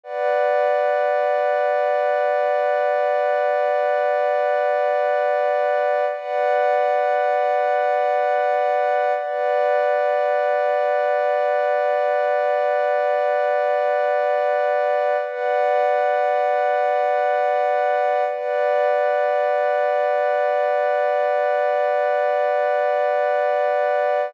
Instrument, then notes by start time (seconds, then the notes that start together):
pad 2 (warm)
0.03 B4 D5 F#5
6.12 B4 D5 F#5
9.15 B4 D5 F#5
15.23 B4 D5 F#5
18.26 B4 D5 F#5